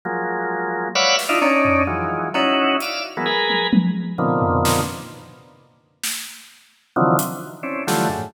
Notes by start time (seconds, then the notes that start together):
0.05 F3 F#3 G#3 A#3
0.95 B4 C#5 D5 E5 F5 F#5
1.19 snare
1.29 D4 D#4 E4 F4
1.41 C#4 D4 D#4, cowbell
1.65 floor tom
1.87 D#3 E3 F3 F#3 G#3
2.34 C#4 D#4 E4 F#4, cowbell
2.80 D5 E5 F5, closed hi-hat
3.17 E3 F#3 G#3 A#3 B3
3.26 G#4 A#4 B4
3.50 high tom
3.73 high tom
4.18 A#2 B2 C3 D3 D#3 F3
4.42 floor tom
4.65 snare
6.03 snare
6.96 C3 D3 D#3 E3 F3 F#3
7.19 closed hi-hat
7.63 C4 C#4 D4 E4
7.87 D3 E3 F3 F#3 G3 A3, snare
8.09 F#2 G#2 A2